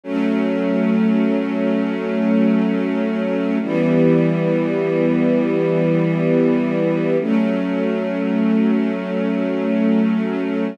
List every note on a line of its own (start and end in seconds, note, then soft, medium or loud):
0.03 3.58 F#3 medium
0.03 3.58 A3 medium
0.03 3.58 C#4 medium
3.62 7.16 E3 medium
3.62 7.16 G3 medium
3.62 7.16 B3 medium
7.20 10.75 F#3 medium
7.20 10.75 A3 medium
7.20 10.75 C#4 medium